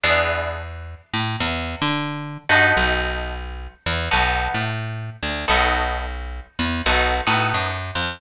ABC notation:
X:1
M:4/4
L:1/8
Q:"Swing" 1/4=88
K:B
V:1 name="Acoustic Guitar (steel)"
[B,=DEG]7 [B,^DF=A]- | [B,DF=A]4 [B,DFA]4 | [B,DF=A]4 [B,DFA] [B,DFA]3 |]
V:2 name="Electric Bass (finger)" clef=bass
E,,3 =A,, E,, =D,2 =G,, | B,,,3 E,, B,,, =A,,2 =D,, | B,,,3 E,, B,,, =A,, F,, =F,, |]